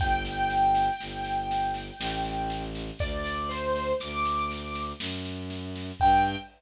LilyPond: <<
  \new Staff \with { instrumentName = "Acoustic Grand Piano" } { \time 3/4 \key g \major \tempo 4 = 60 g''2. | d''8 c''8 d'''4 r4 | g''4 r2 | }
  \new Staff \with { instrumentName = "Violin" } { \clef bass \time 3/4 \key g \major g,,4 g,,4 a,,4 | d,4 d,4 fis,4 | g,4 r2 | }
  \new DrumStaff \with { instrumentName = "Drums" } \drummode { \time 3/4 <bd sn>16 sn16 sn16 sn16 sn16 sn16 sn16 sn16 sn16 sn16 sn16 sn16 | <bd sn>16 sn16 sn16 sn16 sn16 sn16 sn16 sn16 sn16 sn16 sn16 sn16 | <cymc bd>4 r4 r4 | }
>>